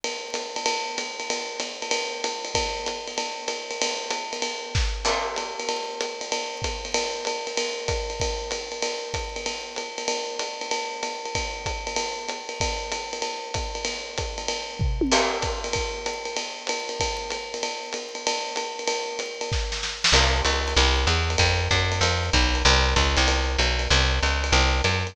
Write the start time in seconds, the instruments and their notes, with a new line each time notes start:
0.04 ride
0.34 hi-hat pedal, ride
0.56 ride
0.66 ride
0.98 hi-hat pedal, ride
1.20 ride
1.30 ride
1.60 hi-hat pedal, ride
1.82 ride
1.91 ride
2.24 hi-hat pedal, ride
2.45 ride
2.55 kick, ride
2.86 hi-hat pedal, ride
3.07 ride
3.18 ride
3.48 hi-hat pedal, ride
3.71 ride
3.81 ride
4.10 hi-hat pedal, ride
4.33 ride
4.42 ride
4.75 kick, snare
5.05 crash, ride
5.36 hi-hat pedal, ride
5.59 ride
5.69 ride
6.01 hi-hat pedal, ride
6.21 ride
6.32 ride
6.62 kick, hi-hat pedal, ride
6.85 ride
6.94 ride
7.25 hi-hat pedal, ride
7.47 ride
7.57 ride
7.88 kick, hi-hat pedal, ride
8.10 ride
8.20 kick, ride
8.51 hi-hat pedal, ride
8.72 ride
8.82 ride
9.14 kick, hi-hat pedal, ride
9.36 ride
9.46 ride
9.76 hi-hat pedal, ride
9.98 ride
10.08 ride
10.39 hi-hat pedal, ride
10.61 ride
10.71 ride
11.03 hi-hat pedal, ride
11.25 ride
11.35 kick, ride
11.66 kick, hi-hat pedal, ride
11.87 ride
11.96 ride
12.28 hi-hat pedal, ride
12.49 ride
12.60 kick, ride
12.92 hi-hat pedal, ride
13.13 ride
13.22 ride
13.54 kick, hi-hat pedal, ride
13.75 ride
13.85 ride
14.18 kick, hi-hat pedal, ride
14.38 ride
14.48 ride
14.79 kick, floor tom
15.01 high tom
15.12 crash, ride
15.42 kick, hi-hat pedal, ride
15.64 ride
15.73 kick, ride
16.06 hi-hat pedal, ride
16.25 ride
16.36 ride
16.67 hi-hat pedal, ride
16.89 ride
17.00 kick, ride
17.30 hi-hat pedal, ride
17.54 ride
17.63 ride
17.93 hi-hat pedal, ride
18.15 ride
18.27 ride
18.56 hi-hat pedal, ride
18.79 ride
18.87 ride
19.19 hi-hat pedal, ride
19.41 ride
19.52 kick, snare
19.72 snare
19.83 snare
20.04 snare
20.12 electric bass (finger) C2, crash, ride
20.45 electric bass (finger) C#2, hi-hat pedal, ride
20.68 ride
20.76 electric bass (finger) C2, ride
21.07 electric bass (finger) E2, hi-hat pedal, ride
21.30 ride
21.38 electric bass (finger) F2, kick, ride
21.71 electric bass (finger) F#2, kick, hi-hat pedal, ride
21.92 ride
22.01 electric bass (finger) F2, ride
22.33 electric bass (finger) B1, kick, hi-hat pedal, ride
22.55 ride
22.65 electric bass (finger) C2, ride
22.96 electric bass (finger) C#2, kick, hi-hat pedal, ride
23.17 electric bass (finger) C2, ride
23.28 ride
23.58 electric bass (finger) B1, hi-hat pedal, ride
23.79 ride
23.90 electric bass (finger) C2, ride
24.22 electric bass (finger) C#2, hi-hat pedal, ride
24.44 ride
24.52 electric bass (finger) C2, ride
24.84 electric bass (finger) F#2, hi-hat pedal, ride
25.07 ride